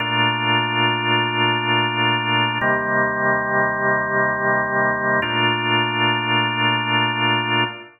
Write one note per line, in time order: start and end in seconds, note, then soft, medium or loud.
0.00 2.58 A#2 loud
0.00 2.58 A3 loud
0.00 2.58 D4 medium
0.00 2.58 F4 medium
2.61 5.20 D#2 medium
2.61 5.20 C3 medium
2.61 5.20 G3 medium
2.61 5.20 A#3 medium
5.22 7.64 A#2 loud
5.22 7.64 A3 loud
5.22 7.64 D4 medium
5.22 7.64 F4 medium